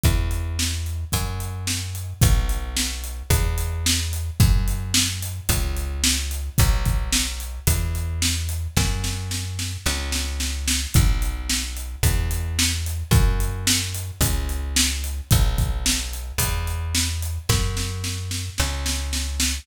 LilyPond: <<
  \new Staff \with { instrumentName = "Electric Bass (finger)" } { \clef bass \time 4/4 \key b \minor \tempo 4 = 110 e,2 fis,2 | b,,2 e,2 | fis,2 cis,2 | b,,2 e,2 |
fis,2 cis,2 | b,,2 e,2 | fis,2 cis,2 | b,,2 e,2 |
fis,2 cis,2 | }
  \new DrumStaff \with { instrumentName = "Drums" } \drummode { \time 4/4 <hh bd>8 hh8 sn8 hh8 <hh bd>8 hh8 sn8 hh8 | <hh bd>8 hh8 sn8 hh8 <hh bd>8 hh8 sn8 hh8 | <hh bd>8 hh8 sn8 hh8 <hh bd>8 hh8 sn8 hh8 | <hh bd>8 <hh bd>8 sn8 hh8 <hh bd>8 hh8 sn8 hh8 |
<bd sn>8 sn8 sn8 sn8 sn8 sn8 sn8 sn8 | <hh bd>8 hh8 sn8 hh8 <hh bd>8 hh8 sn8 hh8 | <hh bd>8 hh8 sn8 hh8 <hh bd>8 hh8 sn8 hh8 | <hh bd>8 <hh bd>8 sn8 hh8 <hh bd>8 hh8 sn8 hh8 |
<bd sn>8 sn8 sn8 sn8 sn8 sn8 sn8 sn8 | }
>>